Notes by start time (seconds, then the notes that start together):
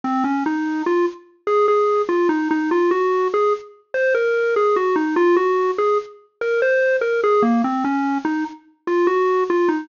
0.04 C4
0.24 C#4
0.46 D#4
0.86 F4
1.47 G#4
1.68 G#4
2.09 F4
2.29 D#4
2.51 D#4
2.71 F4
2.91 F#4
3.34 G#4
3.94 C5
4.14 A#4
4.56 G#4
4.76 F#4
4.96 D#4
5.16 F4
5.36 F#4
5.78 G#4
6.41 A#4
6.62 C5
7.01 A#4
7.23 G#4
7.42 A#3
7.64 C4
7.84 C#4
8.25 D#4
8.87 F4
9.07 F#4
9.50 F4
9.68 D#4